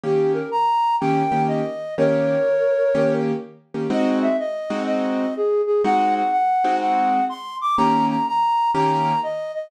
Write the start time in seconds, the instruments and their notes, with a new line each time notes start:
0.04 acoustic grand piano D#3 A#3 C#4 G4, flute G4
0.34 flute A#4
0.52 flute A#5
1.00 acoustic grand piano D#3 A#3 C#4 G4, flute G5
1.32 acoustic grand piano D#3 A#3 C#4 G4
1.48 flute D#5
1.98 acoustic grand piano D#3 A#3 C#4 G4, flute A#4 C#5
2.95 acoustic grand piano D#3 A#3 C#4 G4
3.74 acoustic grand piano D#3 A#3 C#4 G4
3.90 acoustic grand piano G#3 C4 D#4 F#4, flute D#5
4.22 flute E5
4.39 flute D#5
4.70 acoustic grand piano G#3 C4 D#4 F#4
4.87 flute D#5
5.37 flute G#4
5.67 flute G#4
5.84 acoustic grand piano G#3 C4 D#4 F#4, flute F#5
6.15 flute F#5
6.32 flute F#5
6.64 acoustic grand piano G#3 C4 D#4 F#4
6.81 flute F#5
7.29 flute C6
7.61 flute D6
7.78 acoustic grand piano D#3 A#3 C#4 G4, flute A#5
8.09 flute A#5
8.28 flute A#5
8.74 acoustic grand piano D#3 A#3 C#4 G4, flute A#5
9.23 flute D#5
9.54 flute D#5